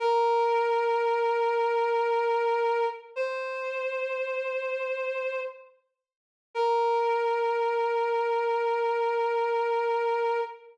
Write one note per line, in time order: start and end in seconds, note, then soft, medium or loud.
0.00 2.86 A#4 loud
3.16 5.41 C5 medium
6.55 10.41 A#4 loud